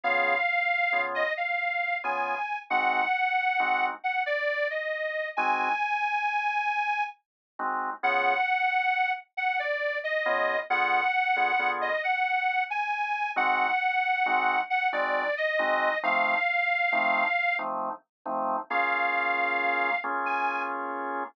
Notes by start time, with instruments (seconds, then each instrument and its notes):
0.04 drawbar organ C#3 B3 F4 G#4, harmonica F5
0.93 drawbar organ C#3 B3 F4 G#4
1.15 harmonica D#5
1.37 harmonica F5
2.04 drawbar organ C#3 B3 F4 G#4, harmonica G#5
2.70 drawbar organ G#3 C4 D#4 F#4, harmonica F#5
3.60 drawbar organ G#3 C4 D#4 F#4
4.04 harmonica F#5
4.26 harmonica D5
4.70 harmonica D#5
5.37 drawbar organ G#3 C4 D#4 F#4, harmonica G#5
7.59 drawbar organ G#3 C4 D#4 F#4
8.03 drawbar organ C#3 B3 F4 G#4, harmonica F#5
9.37 harmonica F#5
9.59 harmonica D5
10.04 harmonica D#5
10.26 drawbar organ C#3 B3 F4 G#4
10.70 drawbar organ D3 B3 F4 G#4, harmonica F#5
11.36 drawbar organ D3 B3 F4 G#4
11.59 drawbar organ D3 B3 F4 G#4
11.81 harmonica D#5
12.03 harmonica F#5
12.70 harmonica G#5
13.36 drawbar organ G#3 C4 D#4 F#4, harmonica F#5
14.26 drawbar organ G#3 C4 D#4 F#4
14.70 harmonica F#5
14.92 drawbar organ G#3 C4 D#4 F#4, harmonica D5
15.37 harmonica D#5
15.59 drawbar organ G#3 C4 D#4 F#4
16.03 drawbar organ F3 A3 C4 D#4, harmonica F5
16.92 drawbar organ F3 A3 C4 D#4
17.59 drawbar organ F3 A3 C4 D#4
18.26 drawbar organ F3 A3 C4 D#4
18.70 drawbar organ A#3 C#4 F4 G#4, harmonica F5
20.04 drawbar organ A#3 C#4 F4 G#4
20.26 harmonica G#5